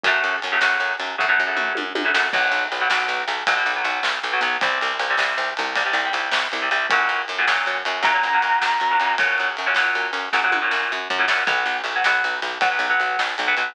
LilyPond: <<
  \new Staff \with { instrumentName = "Distortion Guitar" } { \time 12/8 \key b \minor \tempo 4. = 105 r1. | r1. | r1. | r2. ais''2. |
r1. | r1. | }
  \new Staff \with { instrumentName = "Overdriven Guitar" } { \time 12/8 \key b \minor <cis fis a>4~ <cis fis a>16 <cis fis a>16 <cis fis a>4. <cis fis a>16 <cis fis a>8 <cis fis a>4. <cis fis a>16 <cis fis a>8 | <b, fis>4~ <b, fis>16 <b, fis>16 <b, fis>4. <b, fis>16 <b, fis>8 <b, fis>4. <b, fis>16 <b, fis>8 | <c g>4~ <c g>16 <c g>16 <c g>4. <c g>16 <c g>8 <c g>4. <c g>16 <c g>8 | <ais, cis fis>4~ <ais, cis fis>16 <ais, cis fis>16 <ais, cis fis>4. <ais, cis fis>16 <ais, cis fis>8 <ais, cis fis>4. <ais, cis fis>16 <ais, cis fis>8 |
<ais, cis fis>4~ <ais, cis fis>16 <ais, cis fis>16 <ais, cis fis>4. <ais, cis fis>16 <ais, cis fis>8 <ais, cis fis>4. <ais, cis fis>16 <ais, cis fis>8 | <fis b>4~ <fis b>16 <fis b>16 <fis b>4. <fis b>16 <fis b>8 <fis b>4. <fis b>16 <fis b>8 | }
  \new Staff \with { instrumentName = "Electric Bass (finger)" } { \clef bass \time 12/8 \key b \minor fis,8 fis,8 fis,8 fis,8 fis,8 fis,8 fis,8 fis,8 fis,8 fis,8 fis,8 fis,8 | b,,8 b,,8 b,,8 b,,8 b,,8 b,,8 b,,8 b,,8 b,,8 b,,8 b,,8 b,,8 | c,8 c,8 c,8 c,8 c,8 c,8 c,8 c,8 c,8 c,8 c,8 c,8 | fis,8 fis,8 fis,8 fis,8 fis,8 fis,8 fis,8 fis,8 fis,8 fis,8 fis,8 fis,8 |
fis,8 fis,8 fis,8 fis,8 fis,8 fis,8 fis,8 fis,8 fis,8 fis,8 fis,8 fis,8 | b,,8 b,,8 b,,8 b,,8 b,,8 b,,8 b,,8 b,,8 b,,8 b,,8 b,,8 b,,8 | }
  \new DrumStaff \with { instrumentName = "Drums" } \drummode { \time 12/8 <bd cymr>8 cymr8 cymr8 sn8 cymr8 cymr8 <bd tomfh>8 tomfh8 toml8 tommh8 tommh8 sn8 | <cymc bd>8 cymr8 cymr8 sn8 cymr8 cymr8 <bd cymr>8 cymr8 cymr8 sn8 cymr8 cymr8 | <bd cymr>8 cymr8 cymr8 sn8 cymr8 cymr8 <bd cymr>8 cymr8 cymr8 sn8 cymr8 cymr8 | <bd cymr>8 cymr8 cymr8 sn8 cymr8 cymr8 <bd cymr>8 cymr8 cymr8 sn8 cymr8 cymr8 |
<bd cymr>8 cymr8 cymr8 sn8 cymr8 cymr8 <bd sn>8 tommh8 sn8 r8 tomfh8 sn8 | <bd cymr>8 cymr8 cymr8 sn8 cymr8 cymr8 <bd cymr>8 cymr8 cymr8 sn8 cymr8 cymr8 | }
>>